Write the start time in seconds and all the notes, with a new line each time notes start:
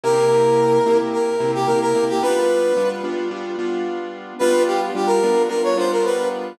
0.04 C3 A#3 E4 G4 A#4
0.86 C3 A#3 E4 G4
1.13 A#4
1.40 C3 A#3 E4 G4
1.55 G4
1.67 C3 A#3 E4 G4 A#4
1.81 A#4
1.95 C3 A#3 E4 G4
2.09 G4
2.22 G3 B3 D4 F4 B4
2.77 G3 B3 D4 F4
3.04 G3 B3 D4 F4
3.31 G3 B3 D4 F4
3.59 G3 B3 D4 F4
4.39 G3 B3 D4 F4 B4
4.67 G4
4.95 G3 B3 D4 F4 G4
5.06 A#4
5.23 G3 B3 D4 F4
5.49 G3 B3 D4 F4 A#4
5.64 C#5
5.77 G3 B3 D4 F4 C5
5.92 A#4
6.05 B4